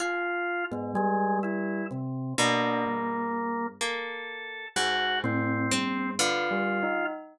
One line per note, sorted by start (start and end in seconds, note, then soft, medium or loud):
0.00 0.64 F4 loud
0.00 0.64 F4 medium
0.00 1.29 G#4 medium
0.71 0.93 G#2 loud
0.71 0.93 B3 medium
0.95 1.81 G3 loud
0.95 1.38 G#3 loud
1.43 1.86 E4 medium
1.91 2.34 C3 medium
2.38 3.67 B2 loud
2.38 3.67 A#3 loud
2.38 2.81 D4 loud
2.86 3.71 G2 medium
3.81 4.67 A#3 medium
3.81 4.67 A4 medium
4.76 5.62 G#2 medium
4.76 5.19 G#3 medium
4.76 5.19 F#4 loud
5.24 5.67 A2 loud
5.24 6.10 C4 loud
5.71 6.14 G2 medium
5.71 6.14 C4 loud
6.19 7.05 D3 loud
6.19 7.05 F4 loud
6.19 6.48 B4 medium
6.51 6.79 G3 medium
6.83 7.11 D#4 medium